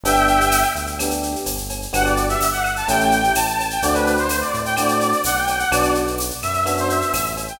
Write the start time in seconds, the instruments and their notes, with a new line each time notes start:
0.04 synth bass 1 G1, electric piano 1 B3 D4 G4, brass section E5 G5, cowbell, shaker
0.16 shaker
0.27 shaker
0.41 shaker
0.51 tambourine, claves, shaker
0.63 shaker
0.75 synth bass 1 D2, shaker
0.87 shaker
0.99 electric piano 1 B3 D4 G4, cowbell, claves, shaker
1.11 shaker
1.23 shaker
1.36 shaker
1.46 synth bass 1 G1, tambourine, cowbell, shaker
1.58 shaker
1.69 cowbell, shaker
1.82 shaker
1.93 synth bass 1 G1, electric piano 1 B3 D4 F#4 G4, brass section F#5, cowbell, claves, shaker
2.05 brass section D5, shaker
2.17 shaker
2.29 brass section E5, shaker
2.41 synth bass 1 G1, tambourine, shaker
2.52 brass section F#5, shaker
2.64 claves, shaker
2.76 brass section A5, shaker
2.88 synth bass 1 A1, electric piano 1 A3 C#4 E4 G4, brass section G5, cowbell, shaker
3.00 shaker
3.11 shaker
3.24 shaker
3.35 synth bass 1 A1, brass section A5, tambourine, cowbell, claves, shaker
3.47 brass section A5, shaker
3.59 cowbell, shaker
3.70 brass section G5, shaker
3.82 synth bass 1 D2, electric piano 1 A3 C4 D4 F#4, brass section D5, shaker
3.94 brass section B4, cowbell, shaker
4.07 shaker
4.17 brass section C5, shaker
4.29 tambourine, claves, shaker
4.40 brass section D5, shaker
4.54 synth bass 1 A2, shaker
4.65 brass section G5, shaker
4.77 electric piano 1 A3 C4 D4 F#4, brass section D5, cowbell, claves, shaker
4.88 shaker
5.01 shaker
5.12 shaker
5.24 synth bass 1 B1, brass section F#5, tambourine, cowbell, shaker
5.36 brass section G5, shaker
5.47 cowbell, shaker
5.58 brass section F#5, shaker
5.71 synth bass 1 B1, electric piano 1 B3 D4 F#4, brass section D5, cowbell, claves, shaker
5.83 shaker
5.95 shaker
6.07 shaker
6.18 tambourine, shaker
6.30 shaker
6.42 synth bass 1 F#2, brass section E5, claves, shaker
6.54 claves, shaker
6.65 electric piano 1 B3 D4 F#4, cowbell, shaker
6.77 brass section C5, shaker
6.90 brass section E5, shaker
7.01 shaker
7.13 synth bass 1 A1, brass section E5, tambourine, cowbell, claves, shaker
7.26 shaker
7.37 cowbell, shaker
7.48 brass section G5, shaker